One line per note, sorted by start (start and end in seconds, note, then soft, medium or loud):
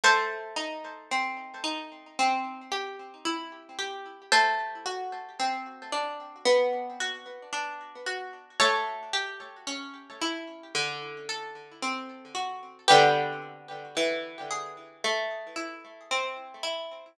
0.04 2.07 A3 medium
0.04 3.87 A4 medium
0.04 3.87 C5 medium
0.56 1.63 D#4 medium
1.11 2.13 C4 medium
1.64 2.15 D#4 medium
2.19 4.23 C4 loud
2.72 3.78 G4 medium
3.25 4.27 E4 medium
3.79 4.30 G4 medium
4.32 6.36 A3 loud
4.32 7.94 A4 medium
4.32 7.94 C5 medium
4.86 6.38 F#4 medium
5.40 6.42 C4 medium
5.92 6.43 D4 medium
6.46 8.49 B3 loud
7.00 8.06 F#4 medium
7.53 8.54 D4 medium
8.06 8.57 F#4 medium
8.60 10.64 A3 loud
8.60 12.44 A4 medium
8.60 12.44 C#5 medium
9.13 10.66 G4 medium
9.67 10.69 C#4 medium
10.22 10.73 E4 medium
10.75 12.78 D3 medium
11.29 12.82 A4 medium
11.83 12.84 C4 medium
12.35 12.86 F#4 medium
12.88 13.87 D3 loud
12.88 13.87 G3 medium
12.88 13.87 B3 loud
12.88 16.74 G4 medium
12.88 16.74 B4 medium
13.97 14.98 E3 medium
14.51 15.02 G#4 medium
15.04 17.08 A3 medium
15.56 16.63 E4 medium
16.11 17.13 C4 medium
16.63 17.14 E4 medium